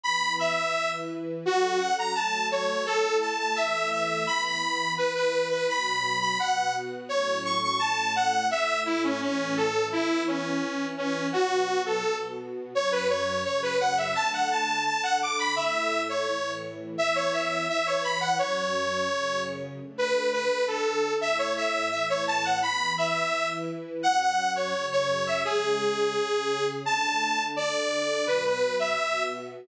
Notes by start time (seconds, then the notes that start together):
0.04 E3 B3 E4 B5
0.39 E5
0.74 E3 E4 B4
1.45 F#3 C#4 F#4 A4
1.79 F#5
1.99 A#5
2.15 F#3 A3 A4 A5
2.51 C#5
2.86 A3 E4 A4
3.21 A5
3.39 A5
3.56 E3 A3 A4 E5
3.92 E5
4.27 E3 B3 E4 B5
4.45 B5
4.98 E3 E4 B4
5.15 B4
5.51 B4
5.68 B2 F#3 B3 B5
6.21 B5
6.39 B2 B3 F#4 F#5
7.09 A2 F#3 C#4 C#5
7.45 C#6
7.63 C#6
7.79 A2 A3 C#4 A5
8.16 F#5
8.51 A2 A3 E4 E5
8.86 E4
9.04 C#4
9.21 A2 E3 C#4 E4
9.57 A4
9.92 E3 B3 E4
10.27 C#4
10.62 E3 E4 B4
10.97 C#4
11.32 B2 F#3 B3 F#4
11.86 A4
12.03 B2 B3 F#4
12.74 F#2 F#3 C#4 C#5
12.92 B4
13.09 C#5
13.45 F#2 C#3 C#4 C#5
13.63 B4
13.80 F#5
13.97 E5
14.15 D3 A3 D4 A5
14.33 F#5
14.51 A5
14.85 D3 D4 A4 A5
15.03 F#5
15.22 D6
15.39 B5
15.56 A2 A3 E4 E5
16.09 C#5
16.27 A2 E3 E4
16.98 E3 B3 E4 E5
17.16 C#5
17.33 E5
17.68 E3 E4 B4 E5
17.86 C#5
18.04 B5
18.21 F#5
18.38 F#2 F#3 C#4 C#5
19.09 F#2 C#3 C#4
19.80 D3 A3 D4
19.98 B4
20.33 B4
20.51 D3 D4 A4
20.68 A4
21.21 A2 A3 E4 E5
21.38 C#5
21.57 E5
21.91 A2 E3 E4 E5
22.10 C#5
22.27 A5
22.44 F#5
22.62 E3 B3 E4 B5
22.98 E5
23.33 E3 E4 B4
24.03 F#2 F#3 C#4 F#5
24.20 F#5
24.56 C#5
24.74 F#2 C#3 C#4
24.92 C#5
25.27 E5
25.45 C#3 G#3 C#4 G#4
26.15 C#3 C#4 G#4
26.86 D3 A3 D4 A5
27.56 D3 D4 A4 D5
28.27 B2 F#3 B3 B4
28.46 B4
28.79 E5
28.98 B2 B3 F#4